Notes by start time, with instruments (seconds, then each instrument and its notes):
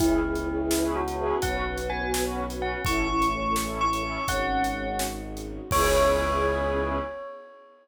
0.00 violin C#2, string ensemble 1 B3 C#4 E4 G#4 B4, choir aahs E4, tubular bells E4, kick, closed hi-hat
0.24 string ensemble 1 C#4 E4 G#4 B4
0.35 string ensemble 1 C#4 E4 G#4 B4, closed hi-hat
0.48 string ensemble 1 C#4 E4 G#4 B4
0.60 string ensemble 1 C#4 E4 G#4 B4
0.71 string ensemble 1 C#4 E4 G#4 B4, snare
0.96 choir aahs E4, tubular bells F#4
1.07 string ensemble 1 C#4 E4 G#4 B4, closed hi-hat
1.42 violin B1, choir aahs B3, string ensemble 1 B3 C#4 F#4 B4, tubular bells F#5, kick, closed hi-hat
1.67 string ensemble 1 C#4 F#4 B4
1.77 string ensemble 1 C#4 F#4 B4, closed hi-hat
1.90 string ensemble 1 C#4 F#4 B4, tubular bells G#5
2.02 string ensemble 1 C#4 F#4 B4
2.14 string ensemble 1 C#4 F#4 B4, snare
2.50 string ensemble 1 C#4 F#4 B4, closed hi-hat
2.62 tubular bells F#5
2.85 violin A1, string ensemble 1 A3 C#4 E4 A4, choir aahs E4, tubular bells C#6, kick, closed hi-hat
3.09 string ensemble 1 C#4 E4 A4, choir aahs E4
3.22 string ensemble 1 C#4 E4 A4, closed hi-hat
3.33 string ensemble 1 C#4 E4 A4, choir aahs C#4
3.45 string ensemble 1 C#4 E4 A4
3.56 string ensemble 1 C#4 E4 A4, snare
3.81 choir aahs E4, tubular bells C#6
3.92 string ensemble 1 C#4 E4 A4, closed hi-hat
4.27 violin G#1, string ensemble 1 G#3 C#4 D#4 F#4, choir aahs C#4, tubular bells F#5, kick, closed hi-hat
4.64 closed hi-hat
4.99 snare
5.37 closed hi-hat
5.70 violin C#2, string ensemble 1 B3 C#4 E4 G#4 B4, choir aahs C#4, tubular bells C#5, kick, crash